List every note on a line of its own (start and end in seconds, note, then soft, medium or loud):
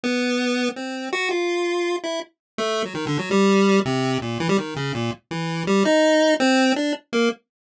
0.03 0.69 B3 medium
0.76 1.09 C4 soft
1.13 1.29 F#4 loud
1.31 1.96 F4 medium
2.03 2.20 E4 medium
2.58 2.83 A3 loud
2.85 2.93 F#3 medium
2.94 3.05 D#3 medium
3.07 3.17 D3 loud
3.19 3.30 F#3 medium
3.31 3.80 G3 loud
3.85 4.18 C3 loud
4.22 4.38 A#2 medium
4.40 4.48 E3 loud
4.49 4.57 G3 loud
4.58 4.74 D#3 medium
4.76 4.92 C#3 medium
4.94 5.11 A#2 medium
5.31 5.63 E3 medium
5.67 5.83 G3 loud
5.85 6.34 D#4 loud
6.40 6.73 C4 loud
6.76 6.93 D4 medium
7.13 7.29 A#3 medium